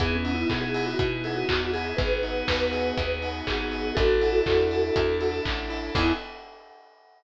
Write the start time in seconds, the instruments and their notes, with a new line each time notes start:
0.00 electric bass (finger) E2, acoustic grand piano B3, pad 5 (bowed) B3 D#4 E4 G#4, vibraphone G#4, kick, closed hi-hat
0.16 vibraphone C#4
0.23 acoustic grand piano D#4, open hi-hat
0.34 vibraphone E4
0.50 electric bass (finger) B2, acoustic grand piano E4, vibraphone G#4, kick, clap
0.61 vibraphone G#4
0.74 acoustic grand piano G#4, open hi-hat
0.86 vibraphone F#4
0.99 electric bass (finger) B2, acoustic grand piano B3, kick, closed hi-hat
1.24 acoustic grand piano D#4, vibraphone G#4, open hi-hat
1.36 vibraphone F#4
1.49 electric bass (finger) E2, acoustic grand piano E4, vibraphone F#4, kick, clap
1.73 vibraphone G#4, acoustic grand piano G#4, open hi-hat
1.97 electric bass (finger) G#1, acoustic grand piano B3, pad 5 (bowed) B3 D#4 F#4 G#4, vibraphone G#4 B4, kick, closed hi-hat
2.23 acoustic grand piano D#4, open hi-hat
2.47 electric bass (finger) D#2, acoustic grand piano F#4, vibraphone B4, kick, snare
2.73 acoustic grand piano G#4, open hi-hat
2.98 electric bass (finger) D#2, acoustic grand piano B3, kick, closed hi-hat
3.22 acoustic grand piano D#4, open hi-hat
3.47 electric bass (finger) G#1, acoustic grand piano F#4, vibraphone G#4, kick, clap
3.72 acoustic grand piano G#4, open hi-hat
3.95 electric bass (finger) A1, pad 5 (bowed) D4 E4 A4, acoustic grand piano D4, vibraphone F#4 A4, kick, closed hi-hat
4.21 acoustic grand piano E4, open hi-hat
4.46 electric bass (finger) E2, acoustic grand piano A4, kick, clap
4.71 acoustic grand piano D4, open hi-hat
4.96 electric bass (finger) E2, acoustic grand piano E4, kick, closed hi-hat
5.21 acoustic grand piano A4, open hi-hat
5.44 electric bass (finger) A1, acoustic grand piano D4, kick, clap
5.70 acoustic grand piano E4, open hi-hat
5.95 electric bass (finger) E2, acoustic grand piano B3 D#4 E4 G#4, pad 5 (bowed) B3 D#4 E4 G#4, vibraphone E4, kick, crash